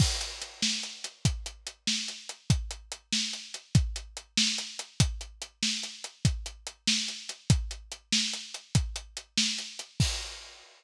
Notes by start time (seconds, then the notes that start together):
0.00 kick, crash
0.21 closed hi-hat
0.42 closed hi-hat
0.62 snare
0.83 closed hi-hat
1.04 closed hi-hat
1.25 kick, closed hi-hat
1.46 closed hi-hat
1.67 closed hi-hat
1.87 snare
2.08 closed hi-hat
2.29 closed hi-hat
2.50 kick, closed hi-hat
2.71 closed hi-hat
2.92 closed hi-hat
3.13 snare
3.33 closed hi-hat
3.54 closed hi-hat
3.75 kick, closed hi-hat
3.96 closed hi-hat
4.17 closed hi-hat
4.38 snare
4.58 closed hi-hat
4.79 closed hi-hat
5.00 kick, closed hi-hat
5.21 closed hi-hat
5.42 closed hi-hat
5.63 snare
5.83 closed hi-hat
6.04 closed hi-hat
6.25 kick, closed hi-hat
6.46 closed hi-hat
6.67 closed hi-hat
6.87 snare
7.08 closed hi-hat
7.29 closed hi-hat
7.50 kick, closed hi-hat
7.71 closed hi-hat
7.92 closed hi-hat
8.12 snare
8.33 closed hi-hat
8.54 closed hi-hat
8.75 kick, closed hi-hat
8.96 closed hi-hat
9.17 closed hi-hat
9.38 snare
9.58 closed hi-hat
9.79 closed hi-hat
10.00 kick, crash